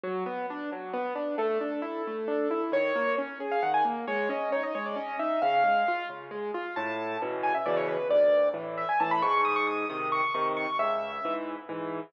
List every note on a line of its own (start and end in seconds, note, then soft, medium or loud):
0.04 0.24 F#3 medium
0.26 0.46 B3 medium
0.50 0.70 D4 medium
0.72 0.92 F#3 medium
0.93 1.14 B3 medium
1.15 1.36 D4 medium
1.38 1.58 A3 medium
1.38 2.61 A4 medium
1.61 1.81 D4 medium
1.82 2.02 E4 medium
2.07 2.27 A3 medium
2.28 2.48 D4 medium
2.51 2.71 E4 medium
2.72 2.92 D#3 medium
2.72 3.15 C#5 medium
2.96 3.16 A#3 medium
3.18 3.38 C#4 medium
3.40 3.60 G#4 medium
3.51 3.62 F5 medium
3.63 3.83 D#3 medium
3.63 3.73 F#5 medium
3.74 3.85 G#5 medium
3.85 4.05 A#3 medium
4.07 4.28 G#3 medium
4.07 4.29 C#5 medium
4.29 4.49 C#4 medium
4.29 4.51 D#5 medium
4.52 4.73 D#4 medium
4.52 4.63 C#5 medium
4.63 4.74 D#5 medium
4.75 4.95 G#3 medium
4.75 4.85 C#5 medium
4.86 4.96 D5 medium
4.96 5.16 C#4 medium
4.96 5.19 D#5 medium
5.19 5.40 D#4 medium
5.19 5.41 E5 medium
5.42 5.63 C#3 medium
5.42 6.06 F5 medium
5.64 5.84 G#3 medium
5.88 6.08 F4 medium
6.09 6.30 C#3 medium
6.31 6.51 G#3 medium
6.54 6.74 F4 medium
6.76 7.17 A2 loud
6.76 7.17 A5 medium
7.22 7.53 B2 medium
7.22 7.53 C#3 medium
7.22 7.53 E3 medium
7.43 7.54 G#5 medium
7.54 7.65 E5 medium
7.66 7.97 B2 medium
7.66 7.97 C#3 medium
7.66 7.97 E3 medium
7.66 7.76 D5 medium
7.77 7.87 C#5 medium
7.88 8.08 B4 medium
8.10 8.50 D2 loud
8.10 8.49 D5 medium
8.54 8.85 A2 medium
8.54 8.85 E3 medium
8.78 8.88 E5 medium
8.89 8.99 G#5 medium
9.00 9.22 A2 medium
9.00 9.22 E3 medium
9.00 9.11 A5 medium
9.11 9.22 B5 medium
9.22 9.85 G#2 loud
9.22 9.41 C#6 medium
9.45 9.55 D#6 medium
9.56 9.67 C#6 medium
9.67 9.88 D#6 medium
9.90 10.21 C3 medium
9.90 10.21 D#3 medium
9.90 10.08 D#6 medium
10.12 10.33 C#6 medium
10.34 10.66 C3 medium
10.34 10.66 D#3 medium
10.34 10.45 C#6 medium
10.57 10.77 C#6 medium
10.79 11.19 C#2 loud
10.79 11.33 E5 medium
11.25 11.56 G#2 medium
11.25 11.56 E3 medium
11.69 12.00 G#2 medium
11.69 12.00 E3 medium